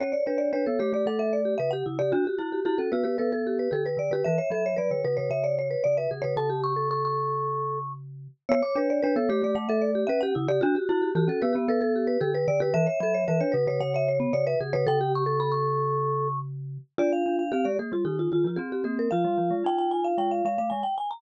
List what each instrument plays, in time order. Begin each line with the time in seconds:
0.00 glockenspiel C#4, vibraphone C#5, marimba C#5
0.12 vibraphone C#5, marimba D5
0.26 glockenspiel D4, marimba B4, vibraphone C#5
0.38 marimba D5
0.53 glockenspiel D4, vibraphone B4, marimba C#5
0.66 glockenspiel B3, vibraphone A4
0.79 glockenspiel A3, vibraphone G4, marimba C#5
0.92 glockenspiel A3, vibraphone G4, marimba D5
1.06 glockenspiel A3, vibraphone A4, marimba F#5
1.19 vibraphone A4, marimba E5
1.33 marimba D5
1.45 vibraphone G4
1.58 glockenspiel C#3, vibraphone B4, marimba E5
1.71 vibraphone G4, marimba F#5
1.86 glockenspiel C#3, vibraphone E4
1.99 glockenspiel C#3, vibraphone G4, marimba D5
2.12 glockenspiel D4, marimba F#4, vibraphone F#4
2.25 vibraphone F#4, marimba G4
2.38 glockenspiel E4, vibraphone F#4, marimba F#4
2.52 marimba G4
2.65 glockenspiel E4, marimba F#4, vibraphone G4
2.78 glockenspiel C#4, vibraphone A4
2.92 glockenspiel B3, marimba F#4, vibraphone B4
3.03 glockenspiel B3, marimba G4, vibraphone B4
3.18 glockenspiel B3, vibraphone A4, marimba B4
3.32 vibraphone A4, marimba A4
3.47 marimba G4
3.59 vibraphone B4
3.71 glockenspiel D3, vibraphone G4, marimba A4
3.86 vibraphone B4, marimba B4
3.97 glockenspiel D3, vibraphone D5
4.11 glockenspiel D3, marimba G4, vibraphone B4
4.24 glockenspiel E3, marimba B4, vibraphone E5
4.38 marimba C#5, vibraphone E5
4.50 glockenspiel F#3, marimba A4, vibraphone E5
4.66 marimba C#5
4.76 glockenspiel F#3, marimba B4, vibraphone D5
4.91 glockenspiel D3, vibraphone C#5
5.04 glockenspiel C#3, vibraphone B4, marimba B4
5.17 glockenspiel C#3, vibraphone B4, marimba C#5
5.30 glockenspiel C#3, vibraphone C#5, marimba E5
5.44 vibraphone C#5, marimba D5
5.59 marimba C#5
5.71 vibraphone B4
5.84 glockenspiel C#3, vibraphone D5, marimba D5
5.97 vibraphone B4, marimba E5
6.11 glockenspiel C#3, vibraphone G#4
6.22 glockenspiel C#3, vibraphone B4, marimba C#5
6.36 glockenspiel C#3, vibraphone A4, marimba A5
6.50 vibraphone G4
6.64 marimba C#6
6.76 vibraphone A4
6.91 vibraphone A4, marimba C#6
7.05 marimba C#6
8.49 glockenspiel B3, vibraphone C#5, marimba C#5
8.62 vibraphone C#5, marimba D6
8.75 glockenspiel D4, marimba B4, vibraphone C#5
8.90 marimba D5
9.02 glockenspiel D4, vibraphone B4, marimba C#5
9.16 glockenspiel B3, vibraphone A4
9.29 glockenspiel A3, vibraphone G4, marimba C#5
9.42 glockenspiel A3, vibraphone G4, marimba D5
9.55 glockenspiel A3, vibraphone A3, marimba F#5
9.69 vibraphone A4, marimba E5
9.82 marimba D5
9.95 vibraphone G4
10.07 glockenspiel C#4, vibraphone B4, marimba E5
10.21 vibraphone G4, marimba F#5
10.35 glockenspiel C#3, vibraphone E4
10.48 glockenspiel C#3, vibraphone G4, marimba D5
10.61 glockenspiel D4, marimba F#4, vibraphone F#4
10.75 vibraphone F#4, marimba G4
10.89 glockenspiel E4, vibraphone F#4, marimba F#4
11.02 marimba G4
11.15 glockenspiel E3, marimba F#4, vibraphone G4
11.28 glockenspiel C#4, vibraphone A4
11.42 glockenspiel B3, marimba G4, vibraphone B4
11.53 vibraphone B3, glockenspiel B3, marimba G4
11.68 glockenspiel B3, vibraphone A4, marimba B4
11.81 marimba A4, vibraphone A4
11.96 marimba G4
12.07 vibraphone B4
12.21 glockenspiel D3, vibraphone G4, marimba A4
12.34 vibraphone B4, marimba B4
12.48 glockenspiel D3, vibraphone D5
12.60 glockenspiel D3, marimba G4, vibraphone B4
12.74 glockenspiel E3, marimba B4, vibraphone E5
12.86 marimba C#5, vibraphone E5
13.00 glockenspiel F#3, marimba A4, vibraphone E5
13.14 marimba C#5
13.28 glockenspiel E3, marimba B4, vibraphone E5
13.40 glockenspiel D4, vibraphone C#5
13.52 glockenspiel C#3, marimba B4, vibraphone B4
13.67 glockenspiel C#3, vibraphone B4, marimba C#5
13.80 glockenspiel C#3, vibraphone C#5, marimba F#5
13.94 vibraphone C#5, marimba E5
14.08 marimba C#5
14.20 vibraphone B3
14.33 glockenspiel C#3, vibraphone C#5, marimba D5
14.47 vibraphone B4, marimba E5
14.61 glockenspiel C#3, vibraphone G#4
14.73 glockenspiel C#3, vibraphone B4, marimba C#5
14.87 glockenspiel C#3, vibraphone A4, marimba G5
15.01 vibraphone G4
15.15 marimba C#6
15.26 vibraphone A4
15.40 vibraphone A4, marimba B5
15.52 marimba C#6
16.98 glockenspiel D4, marimba F4, vibraphone D5
17.12 vibraphone F5
17.26 glockenspiel D4
17.39 vibraphone F5
17.52 glockenspiel C4, marimba G4, vibraphone F5
17.64 glockenspiel G#3, marimba G4, vibraphone D5
17.79 glockenspiel A#3, marimba G#4
17.92 glockenspiel G3, marimba F4
18.05 glockenspiel D#3, vibraphone D#4, marimba G4
18.19 marimba F4
18.32 glockenspiel D#3, vibraphone F4, marimba F4
18.44 glockenspiel F3, marimba F4
18.56 glockenspiel C4, vibraphone C4, marimba G#4
18.72 marimba G4
18.84 glockenspiel A#3, vibraphone C4, marimba G#4
18.99 marimba A#4
19.11 glockenspiel F3, vibraphone F4, marimba F5
19.24 glockenspiel G3
19.38 glockenspiel F3
19.51 glockenspiel G#3
19.64 glockenspiel D#4, marimba G5
19.78 marimba G5
19.91 marimba G#5
20.04 marimba F5
20.18 glockenspiel G#3, marimba G5
20.31 marimba F5
20.45 glockenspiel G#3, marimba F5
20.58 glockenspiel A3, marimba F5
20.70 glockenspiel G#3, marimba G#5
20.83 marimba G5
20.98 marimba G#5
21.11 marimba A#5